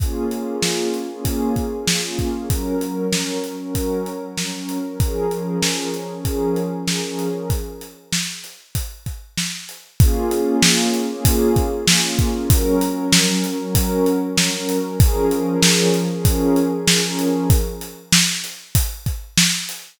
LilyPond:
<<
  \new Staff \with { instrumentName = "Pad 2 (warm)" } { \time 4/4 \key bes \minor \tempo 4 = 96 <bes des' f' aes'>8 <bes des' f' aes'>8 <bes des' f' aes'>8 <bes des' f' aes'>16 <bes des' f' aes'>4~ <bes des' f' aes'>16 <bes des' f' aes'>16 <bes des' f' aes'>8 <bes des' f' aes'>16 | <ges des' bes'>8 <ges des' bes'>8 <ges des' bes'>8 <ges des' bes'>16 <ges des' bes'>4~ <ges des' bes'>16 <ges des' bes'>16 <ges des' bes'>8 <ges des' bes'>16 | <f des' aes' bes'>8 <f des' aes' bes'>8 <f des' aes' bes'>8 <f des' aes' bes'>16 <f des' aes' bes'>4~ <f des' aes' bes'>16 <f des' aes' bes'>16 <f des' aes' bes'>8 <f des' aes' bes'>16 | r1 |
<bes des' f' aes'>8 <bes des' f' aes'>8 <bes des' f' aes'>8 <bes des' f' aes'>16 <bes des' f' aes'>4~ <bes des' f' aes'>16 <bes des' f' aes'>16 <bes des' f' aes'>8 <bes des' f' aes'>16 | <ges des' bes'>8 <ges des' bes'>8 <ges des' bes'>8 <ges des' bes'>16 <ges des' bes'>4~ <ges des' bes'>16 <ges des' bes'>16 <ges des' bes'>8 <ges des' bes'>16 | <f des' aes' bes'>8 <f des' aes' bes'>8 <f des' aes' bes'>8 <f des' aes' bes'>16 <f des' aes' bes'>4~ <f des' aes' bes'>16 <f des' aes' bes'>16 <f des' aes' bes'>8 <f des' aes' bes'>16 | r1 | }
  \new DrumStaff \with { instrumentName = "Drums" } \drummode { \time 4/4 <hh bd>8 hh8 sn8 hh8 <hh bd>8 <hh bd>8 sn8 <hh bd>8 | <hh bd>8 hh8 sn8 hh8 <hh bd>8 hh8 sn8 hh8 | <hh bd>8 hh8 sn8 hh8 <hh bd>8 hh8 sn8 hh8 | <hh bd>8 hh8 sn8 hh8 <hh bd>8 <hh bd>8 sn8 hh8 |
<hh bd>8 hh8 sn8 hh8 <hh bd>8 <hh bd>8 sn8 <hh bd>8 | <hh bd>8 hh8 sn8 hh8 <hh bd>8 hh8 sn8 hh8 | <hh bd>8 hh8 sn8 hh8 <hh bd>8 hh8 sn8 hh8 | <hh bd>8 hh8 sn8 hh8 <hh bd>8 <hh bd>8 sn8 hh8 | }
>>